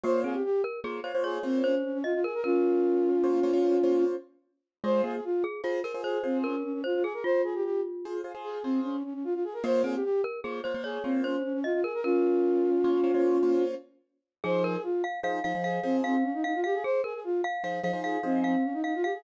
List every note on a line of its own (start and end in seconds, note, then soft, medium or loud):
0.04 0.36 A#3 loud
0.04 0.23 A#3 medium
0.04 0.36 F4 loud
0.04 0.36 C5 loud
0.04 0.21 C5 loud
0.04 0.36 C#5 loud
0.24 0.43 C4 medium
0.24 0.34 G#4 medium
0.34 0.43 G4 medium
0.45 0.62 G4 loud
0.64 0.80 A#4 medium
0.84 1.00 A#3 loud
0.84 1.00 F4 medium
0.84 1.01 G#4 medium
0.84 1.00 C5 medium
0.84 1.00 C#5 medium
1.04 1.12 A#3 medium
1.04 1.12 F4 loud
1.04 1.12 C5 medium
1.04 1.22 C5 medium
1.04 1.12 C#5 medium
1.15 1.39 A#3 medium
1.15 1.39 F4 medium
1.15 1.39 C5 loud
1.15 1.39 C#5 loud
1.24 1.42 G#4 loud
1.24 1.58 C#5 medium
1.43 1.75 A#3 loud
1.43 1.61 C4 loud
1.43 1.75 F4 medium
1.43 1.75 C5 loud
1.43 1.75 C#5 medium
1.64 1.83 C#4 loud
1.64 1.98 C5 medium
1.84 1.93 C#4 medium
1.94 2.03 C#4 loud
2.04 2.13 F4 loud
2.04 2.20 D#5 medium
2.14 2.24 F4 loud
2.24 2.33 G#4 medium
2.24 2.41 A#4 medium
2.34 2.44 A#4 loud
2.44 4.04 C#4 loud
2.44 4.04 F4 loud
2.44 3.09 A#4 medium
3.24 3.40 A#3 medium
3.24 3.40 F4 medium
3.24 3.40 C5 loud
3.24 3.40 C#5 medium
3.43 3.51 A#3 loud
3.43 3.51 F4 medium
3.43 3.51 C5 loud
3.43 3.51 C#5 loud
3.53 3.77 A#3 medium
3.53 3.77 F4 medium
3.53 3.77 C5 loud
3.53 3.77 C#5 loud
3.84 4.16 A#3 medium
3.84 4.16 F4 loud
3.84 4.16 C5 medium
3.84 4.16 C#5 medium
4.84 5.01 G#3 medium
4.84 5.16 F4 loud
4.84 5.16 G#4 loud
4.84 5.16 C5 loud
4.84 5.02 C5 loud
5.04 5.20 A#3 medium
5.04 5.13 G#4 loud
5.14 5.24 G#4 medium
5.24 5.43 F4 loud
5.44 5.61 G#4 medium
5.64 5.80 F4 medium
5.64 5.82 F4 medium
5.64 5.80 G#4 loud
5.64 5.80 C5 medium
5.84 5.92 F4 medium
5.84 5.92 G#4 loud
5.84 6.02 A#4 medium
5.84 5.92 C5 medium
5.94 6.18 F4 medium
5.94 6.18 G#4 medium
5.94 6.18 C5 medium
6.04 6.22 G#4 loud
6.04 6.38 C5 medium
6.23 6.43 C4 medium
6.23 6.55 F4 medium
6.23 6.55 G#4 loud
6.23 6.55 C5 medium
6.44 6.63 C#4 medium
6.44 6.81 A#4 medium
6.64 6.73 C#4 medium
6.73 6.83 C#4 medium
6.84 6.94 F4 medium
6.84 7.03 C5 medium
6.94 7.04 F4 loud
7.03 7.13 G#4 loud
7.03 7.24 G#4 medium
7.14 7.23 A#4 medium
7.24 8.17 F4 medium
7.24 7.42 C5 loud
7.44 7.54 G#4 loud
7.55 7.64 G4 loud
7.64 7.81 G4 loud
8.05 8.21 F4 medium
8.05 8.21 G#4 loud
8.05 8.21 C5 medium
8.24 8.32 F4 loud
8.24 8.32 G#4 medium
8.24 8.32 C5 medium
8.35 8.59 F4 loud
8.35 8.59 G#4 loud
8.35 8.59 C5 medium
8.44 8.63 G#4 loud
8.63 8.80 C4 loud
8.63 8.96 F4 medium
8.63 8.96 G#4 loud
8.63 8.96 C5 medium
8.84 9.03 C#4 loud
9.04 9.13 C#4 medium
9.14 9.23 C#4 medium
9.24 9.34 F4 loud
9.34 9.44 F4 loud
9.44 9.54 G#4 loud
9.53 9.63 A#4 loud
9.64 9.96 A#3 loud
9.64 9.83 A#3 medium
9.64 9.96 F4 loud
9.64 9.96 C5 loud
9.64 9.82 C5 loud
9.64 9.96 C#5 loud
9.84 10.02 C4 medium
9.84 9.94 G#4 medium
9.94 10.04 G4 medium
10.04 10.21 G4 loud
10.24 10.40 A#4 medium
10.44 10.60 A#3 loud
10.44 10.60 F4 medium
10.44 10.61 G#4 medium
10.44 10.60 C5 medium
10.44 10.60 C#5 medium
10.64 10.73 A#3 medium
10.64 10.73 F4 loud
10.64 10.82 C5 medium
10.64 10.73 C5 medium
10.64 10.73 C#5 medium
10.74 10.98 A#3 medium
10.74 10.98 F4 medium
10.74 10.98 C5 loud
10.74 10.98 C#5 loud
10.84 11.03 G#4 loud
10.84 11.18 C#5 medium
11.04 11.36 A#3 loud
11.04 11.21 C4 loud
11.04 11.36 F4 medium
11.04 11.36 C5 loud
11.04 11.36 C#5 medium
11.24 11.43 C#4 loud
11.24 11.58 C5 medium
11.44 11.53 C#4 medium
11.54 11.63 C#4 loud
11.64 11.73 F4 loud
11.64 11.80 D#5 medium
11.74 11.83 F4 loud
11.84 11.93 G#4 medium
11.84 12.01 A#4 medium
11.94 12.04 A#4 loud
12.04 13.64 C#4 loud
12.04 13.64 F4 loud
12.04 12.70 A#4 medium
12.84 13.00 A#3 medium
12.84 13.00 F4 medium
12.84 13.00 C5 loud
12.84 13.00 C#5 medium
13.04 13.12 A#3 loud
13.04 13.12 F4 medium
13.04 13.12 C5 loud
13.04 13.12 C#5 loud
13.14 13.38 A#3 medium
13.14 13.38 F4 medium
13.14 13.38 C5 loud
13.14 13.38 C#5 loud
13.43 13.75 A#3 medium
13.43 13.75 F4 loud
13.43 13.75 C5 medium
13.43 13.75 C#5 medium
14.44 14.77 F3 loud
14.44 14.77 D#4 loud
14.44 14.63 G#4 medium
14.44 14.77 G#4 loud
14.44 14.63 C5 loud
14.44 14.77 C5 loud
14.64 14.74 G#4 medium
14.64 14.82 A#4 medium
14.74 14.84 G#4 loud
14.83 15.02 F4 loud
15.04 15.20 F5 medium
15.23 15.39 F3 medium
15.23 15.39 D#4 loud
15.23 15.39 G#4 medium
15.23 15.39 C5 loud
15.23 15.43 F5 medium
15.44 15.53 F3 loud
15.44 15.53 D#4 medium
15.44 15.53 G#4 loud
15.44 15.53 C5 loud
15.44 15.63 F5 medium
15.55 15.79 F3 medium
15.55 15.79 D#4 medium
15.55 15.79 G#4 medium
15.55 15.79 C5 medium
15.64 15.80 G#4 medium
15.64 15.97 F5 medium
15.83 16.15 F3 loud
15.83 16.01 C4 loud
15.83 16.15 D#4 medium
15.83 16.15 G#4 loud
15.83 16.15 C5 loud
16.04 16.24 C4 loud
16.04 16.42 F5 medium
16.23 16.33 C#4 loud
16.34 16.43 D#4 loud
16.44 16.53 D#4 medium
16.44 16.60 F5 medium
16.55 16.64 F4 medium
16.64 16.74 G4 loud
16.64 16.83 F5 medium
16.74 16.84 G#4 loud
16.84 17.02 G#4 medium
16.84 17.01 C5 loud
17.04 17.13 G#4 medium
17.04 17.20 A#4 medium
17.14 17.23 G#4 medium
17.24 17.41 F4 loud
17.44 17.63 F5 medium
17.64 17.80 F3 loud
17.64 17.80 D#4 medium
17.64 17.80 G#4 medium
17.64 17.80 C5 medium
17.64 17.82 F5 medium
17.83 17.91 F3 medium
17.83 17.91 D#4 loud
17.83 17.91 G#4 loud
17.83 17.91 C5 medium
17.83 18.01 F5 medium
17.93 18.17 F3 loud
17.93 18.17 D#4 loud
17.93 18.17 G#4 medium
17.93 18.17 C5 loud
18.04 18.20 G#4 medium
18.04 18.40 F5 medium
18.23 18.55 F3 medium
18.23 18.43 C4 loud
18.23 18.55 D#4 loud
18.23 18.55 G#4 medium
18.23 18.55 C5 loud
18.44 18.64 C4 loud
18.44 18.80 F5 medium
18.64 18.73 C#4 medium
18.73 18.83 D#4 loud
18.84 18.94 D#4 medium
18.84 19.02 F5 medium
18.95 19.04 F4 loud
19.04 19.13 G4 medium
19.04 19.21 F5 medium
19.14 19.23 G#4 loud